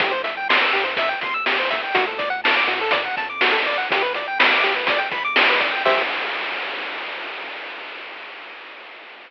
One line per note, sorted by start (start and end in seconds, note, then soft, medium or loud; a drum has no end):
0.00 0.63 C2 medium
0.00 0.13 G4 medium
0.00 kick loud
0.00 closed hi-hat loud
0.11 0.22 C5 medium
0.24 0.35 E5 medium
0.24 closed hi-hat medium
0.37 0.48 G5 medium
0.49 0.60 C6 medium
0.49 snare loud
0.63 0.74 E6 medium
0.73 1.14 G2 medium
0.73 0.84 G4 medium
0.73 closed hi-hat medium
0.84 0.95 C5 medium
0.97 1.09 E5 medium
0.97 kick loud
0.97 closed hi-hat loud
1.09 1.20 G5 medium
1.21 1.85 D#2 medium
1.21 1.34 C6 medium
1.21 kick medium
1.21 closed hi-hat medium
1.34 1.45 E6 medium
1.46 1.58 G4 medium
1.46 snare loud
1.59 1.70 C5 medium
1.71 1.82 E5 medium
1.71 kick medium
1.71 closed hi-hat medium
1.83 1.94 G5 medium
1.95 2.57 D2 medium
1.95 2.05 F#4 loud
1.95 kick loud
1.95 closed hi-hat loud
2.07 2.18 A4 medium
2.18 2.29 D5 medium
2.18 kick medium
2.18 closed hi-hat medium
2.30 2.41 F#5 medium
2.44 2.55 A5 medium
2.44 snare loud
2.56 2.67 D6 medium
2.67 3.09 A2 medium
2.67 2.79 F#4 medium
2.67 closed hi-hat medium
2.81 2.92 A4 medium
2.91 3.03 D5 medium
2.91 kick loud
2.91 closed hi-hat loud
3.05 3.16 F#5 medium
3.17 3.79 F2 medium
3.17 3.29 A5 medium
3.17 kick medium
3.17 closed hi-hat medium
3.30 3.41 D6 medium
3.41 3.52 F#4 medium
3.41 snare loud
3.52 3.63 A4 loud
3.65 3.77 D5 medium
3.65 closed hi-hat medium
3.78 3.89 F#5 medium
3.89 4.51 G1 medium
3.89 4.02 G4 loud
3.89 kick loud
3.89 closed hi-hat loud
4.02 4.13 B4 medium
4.14 4.27 D5 medium
4.14 closed hi-hat medium
4.28 4.39 G5 medium
4.39 4.50 B5 medium
4.39 snare loud
4.53 4.64 D6 medium
4.63 5.05 D2 medium
4.63 4.75 G4 medium
4.63 closed hi-hat medium
4.76 4.87 B4 medium
4.87 5.00 D5 medium
4.87 kick loud
4.87 closed hi-hat loud
4.98 5.09 G5 medium
5.11 5.74 A#1 medium
5.11 5.23 B5 medium
5.11 kick loud
5.11 closed hi-hat medium
5.24 5.35 D6 medium
5.36 5.49 G4 medium
5.36 snare loud
5.49 5.60 B4 medium
5.60 5.71 D5 medium
5.60 kick loud
5.60 closed hi-hat medium
5.72 5.83 G5 medium
5.85 6.03 C2 loud
5.85 6.02 G4 medium
5.85 6.02 C5 medium
5.85 6.02 E5 loud
5.85 kick loud
5.85 crash loud